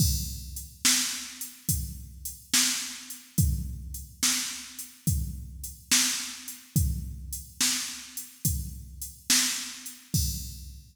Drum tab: CC |x-----------|------------|------------|x-----------|
HH |--x--xx-x--x|x-x--xx-x--x|x-x--xx-x--x|------------|
SD |---o-----o--|---o-----o--|---o-----o--|------------|
BD |o-----o-----|o-----o-----|o-----o-----|o-----------|